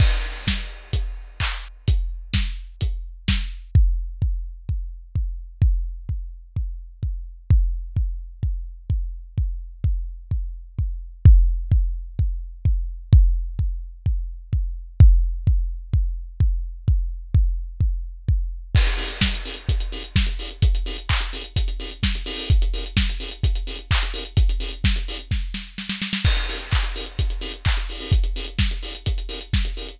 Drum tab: CC |x---------------|----------------|----------------|----------------|
HH |--------x-------|x-------x-------|----------------|----------------|
CP |------------x---|----------------|----------------|----------------|
SD |----o-----------|----o-------o---|----------------|----------------|
BD |o---o---o---o---|o---o---o---o---|o---o---o---o---|o---o---o---o---|

CC |----------------|----------------|----------------|----------------|
HH |----------------|----------------|----------------|----------------|
CP |----------------|----------------|----------------|----------------|
SD |----------------|----------------|----------------|----------------|
BD |o---o---o---o---|o---o---o---o---|o---o---o---o---|o---o---o---o---|

CC |----------------|----------------|x---------------|----------------|
HH |----------------|----------------|-xox-xoxxxox-xox|xxox-xoxxxox-xoo|
CP |----------------|----------------|----------------|----x-----------|
SD |----------------|----------------|----o-------o---|------------o---|
BD |o---o---o---o---|o---o---o---o---|o---o---o---o---|o---o---o---o---|

CC |----------------|----------------|x---------------|----------------|
HH |xxox-xoxxxox-xox|xxox-xox--------|-xox-xoxxxox-xoo|xxox-xoxxxox-xox|
CP |------------x---|----------------|----x-------x---|----------------|
SD |----o-----------|----o---o-o-oooo|----------------|----o-------o---|
BD |o---o---o---o---|o---o---o-------|o---o---o---o---|o---o---o---o---|